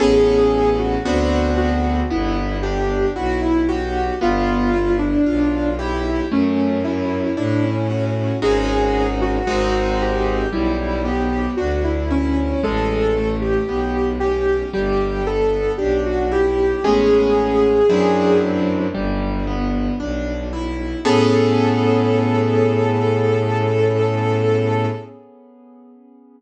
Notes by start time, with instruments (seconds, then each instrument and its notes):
0.00 violin A1, acoustic grand piano B3 C#4 G#4 A4, ocarina G#4
0.79 ocarina F#4
1.05 violin D2, acoustic grand piano B3 C4 D4 F#4
1.57 ocarina F#4
2.10 violin G1, acoustic grand piano B3, ocarina E4
2.62 acoustic grand piano D4, ocarina G4
3.16 violin B1, acoustic grand piano E4, ocarina F#4
3.42 ocarina E4
3.68 ocarina F#4, acoustic grand piano G4
4.21 violin G1, acoustic grand piano B3, ocarina F4
4.73 acoustic grand piano E4
4.99 ocarina D4
5.26 violin B1, acoustic grand piano F4
5.79 ocarina E4, acoustic grand piano G4
6.32 violin F#2, acoustic grand piano A3, ocarina C#4
6.84 acoustic grand piano C#4, ocarina E4
7.37 violin A2, ocarina D4, acoustic grand piano E4
7.63 ocarina C#4
7.89 ocarina C#4, acoustic grand piano F#4
8.42 violin G#1, acoustic grand piano G#3 C#4 D#4 F#4, ocarina G#4
9.21 ocarina F#4
9.47 violin G#1, acoustic grand piano G#3 C4 D#4 F#4
10.02 ocarina G4
10.52 violin B1, acoustic grand piano G3, ocarina E4
11.04 acoustic grand piano B3, ocarina G4
11.57 violin D2, acoustic grand piano D4, ocarina F#4
11.84 ocarina E4
12.11 ocarina C#4, acoustic grand piano E4
12.63 violin A1, acoustic grand piano G#3, ocarina A4
13.16 acoustic grand piano A3
13.41 ocarina G4
13.68 violin B1, acoustic grand piano B3
14.20 acoustic grand piano C#4, ocarina G4
14.73 violin G1, acoustic grand piano G3, ocarina G4
15.27 acoustic grand piano B3, ocarina A4
15.77 violin B1, acoustic grand piano D4, ocarina G4
16.06 ocarina F#4
16.32 acoustic grand piano E4, ocarina G4
16.84 violin A1, acoustic grand piano G#3 A3 B3 C#4, ocarina G#4
17.89 violin F#2, acoustic grand piano F#3 C4 D4 E4
18.95 violin G1, acoustic grand piano G3
19.47 acoustic grand piano B3
20.00 violin B1, acoustic grand piano D4
20.53 acoustic grand piano E4
21.05 violin A2, acoustic grand piano B3 C#4 G#4 A4, ocarina A4